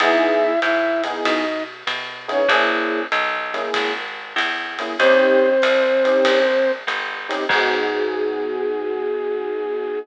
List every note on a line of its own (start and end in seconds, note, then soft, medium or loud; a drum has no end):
0.00 0.58 E2 loud
0.00 0.51 B3 loud
0.00 0.51 D#4 loud
0.00 0.51 E4 loud
0.00 0.60 E4 loud
0.00 0.51 G#4 loud
0.00 0.60 E5 loud
0.00 kick medium
0.00 ride loud
0.62 1.21 G#2 medium
0.62 1.02 E4 medium
0.62 1.02 E5 loud
0.62 hi-hat pedal medium
0.62 ride medium
1.04 1.41 B3 medium
1.04 1.41 D#4 loud
1.04 1.41 E4 medium
1.04 1.41 G#4 loud
1.04 ride medium
1.24 1.84 B2 medium
1.24 1.63 D#4 medium
1.24 1.63 D#5 medium
1.24 kick medium
1.24 ride loud
1.87 2.45 B2 loud
1.87 hi-hat pedal loud
1.87 ride medium
2.28 2.42 B3 loud
2.28 2.49 C#4 medium
2.28 2.42 D#4 loud
2.28 2.42 E4 loud
2.28 2.42 G#4 loud
2.28 2.49 C#5 loud
2.28 ride medium
2.48 3.07 A#1 loud
2.48 3.00 A#3 loud
2.48 3.00 C#4 loud
2.48 3.00 E4 loud
2.48 3.00 G#4 loud
2.48 kick medium
2.48 ride loud
3.12 3.70 B1 loud
3.12 hi-hat pedal medium
3.12 ride medium
3.54 3.91 A#3 loud
3.54 3.91 C#4 loud
3.54 3.91 E4 loud
3.54 3.91 G#4 loud
3.54 ride medium
3.74 4.35 G#1 medium
3.74 kick medium
3.74 ride loud
4.36 4.94 E2 loud
4.36 hi-hat pedal medium
4.36 ride loud
4.79 4.94 A#3 loud
4.79 4.94 C#4 loud
4.79 4.94 E4 loud
4.79 4.94 G#4 medium
4.79 ride medium
4.99 5.58 D#2 loud
4.99 5.50 C4 loud
4.99 6.71 C4 loud
4.99 5.50 C#4 loud
4.99 5.50 D#4 loud
4.99 5.50 G4 loud
4.99 6.71 C5 loud
4.99 kick medium
4.99 ride loud
5.62 6.21 C2 medium
5.62 hi-hat pedal medium
5.62 ride loud
6.05 6.42 C4 medium
6.05 6.42 C#4 loud
6.05 6.42 D#4 medium
6.05 6.42 G4 loud
6.05 ride medium
6.25 6.84 A#1 medium
6.25 kick medium
6.25 ride loud
6.87 7.46 G1 medium
6.87 hi-hat pedal medium
6.87 ride medium
7.29 7.43 C4 loud
7.29 7.43 C#4 loud
7.29 7.43 D#4 loud
7.29 7.43 G4 loud
7.29 ride medium
7.49 9.97 G#2 loud
7.49 9.98 B3 loud
7.49 9.98 D#4 loud
7.49 9.98 F#4 loud
7.49 9.98 G#4 loud
7.49 9.99 G#4 loud
7.49 kick loud
7.49 crash loud